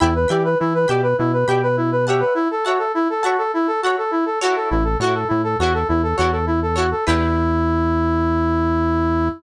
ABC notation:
X:1
M:4/4
L:1/16
Q:1/4=102
K:Edor
V:1 name="Brass Section"
E B G B E B G B E B G B E B G B | E A F A E A F A E A F A E A F A | E A F A E A F A E A F A E A F A | E16 |]
V:2 name="Acoustic Guitar (steel)"
[degb]2 [degb]4 [degb]4 [degb]4 [cefa]2- | [cefa]2 [cefa]4 [cefa]4 [cefa]4 [EFAc]2- | [EFAc]2 [EFAc]4 [EFAc]4 [EFAc]4 [EFAc]2 | [DEGB]16 |]
V:3 name="Synth Bass 1" clef=bass
E,,2 E,2 E,2 B,,2 B,,2 B,,6 | z16 | A,,,2 A,,2 A,,2 E,,2 E,,2 E,,6 | E,,16 |]